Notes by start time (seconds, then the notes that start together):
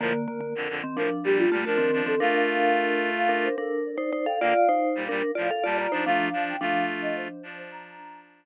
0.00 A2 D3 F3 A#3 A#4
0.14 A#4
0.28 D3 A#3
0.40 D3 A#3
0.55 F2 D3
0.69 F2 D3
0.84 D#3 C4
0.96 A2 F3 D4 A#4
1.24 A#2 G3 G4
1.38 F4
1.51 A#2 G3 A3 F4
1.65 F3 A3 D4 F4 A#4
1.78 D#3 C4
1.93 F3 D4
2.06 D#3 C4 A4
2.20 A3 D4 F4 A#4 F5
2.34 F5
3.17 F5
3.29 D4 A#4
3.44 C5
3.58 D4 A4 A#4
3.86 D5
3.98 D#4 C5
4.13 D#4 C5
4.26 A4 F5 G5
4.40 D3 A#3 F4 D5 F5
4.55 F5
4.69 D#4 C5
4.95 A#2 G3
5.09 A#2 G3 D4 A#4
5.35 A2 F3 F4 D5 F5
5.51 A4 F5
5.64 A#2 G3 F4 D5 A5
5.77 F4 D5 A#5
5.92 F3 D4 D#4 C5
6.06 F3 A3 D4 F4 F5
6.33 F3 D4
6.47 G5
6.61 F3 A3 D4 F4 F5
7.02 D#5
7.16 C5
7.29 C5
7.43 F3 D4 C5
7.57 C5
7.71 A#5